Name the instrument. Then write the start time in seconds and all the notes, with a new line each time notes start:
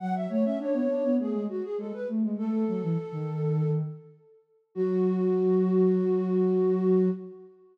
flute
0.00 F#3 F#5
0.15 E5
0.29 A3 C#5
0.44 C#4 E5
0.59 D4 C#5
0.73 B3
0.89 D4
1.04 B3
1.19 A3 G#4
1.33 G#3
1.49 F#4
1.63 G#4
1.78 G#3 A4
1.93 B4
2.08 A3
2.23 G#3
2.38 A3 A4
2.68 F#3
2.83 E3
3.12 D#3
4.75 F#3 F#4